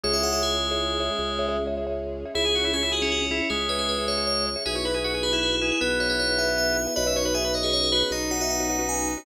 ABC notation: X:1
M:12/8
L:1/16
Q:3/8=104
K:C#m
V:1 name="Tubular Bells"
c e f e G12 z8 | G4 G2 F C F C C C G2 B G B2 c2 c2 c2 | B4 B2 G E G E E E B2 c B c2 e2 e2 e2 | d4 e2 c G c G G G d2 f e f2 f2 g2 g2 |]
V:2 name="Drawbar Organ"
G,18 z6 | E G F E C E G4 E2 G,12 | G c B G F G B4 G2 B,12 | B e c B G B d4 B2 D12 |]
V:3 name="Marimba"
[Gce] [Gce] [Gce] [Gce]4 [Gce]3 [Gce]4 [Gce] [Gce]2 [Gce] [Gce] [Gce]4 [Gce] | [Gce] [Gce] [Gce] [Gce]4 [Gce]3 [Gce]4 [Gce] [Gce]2 [Gce] [Gce] [Gce]4 [Gce] | [FGBe] [FGBe] [FGBe] [FGBe]4 [FGBe]3 [FGBe]4 [FGBe] [FGBe]2 [FGBe] [FGBe] [FGBe]4 [FGBe] | [FBcd] [FBcd] [FBcd] [FBcd]4 [FBcd]3 [FBcd]4 [FBcd] [FBcd]2 [FBcd] [FBcd] [FBcd]4 [FBcd] |]
V:4 name="Drawbar Organ" clef=bass
C,,12 C,,12 | C,,12 C,,12 | B,,,12 B,,,12 | B,,,12 B,,,12 |]
V:5 name="String Ensemble 1"
[CEG]12 [G,CG]12 | [CEG]12 [G,CG]12 | [B,EFG]12 [B,EGB]12 | [B,CDF]12 [B,CFB]12 |]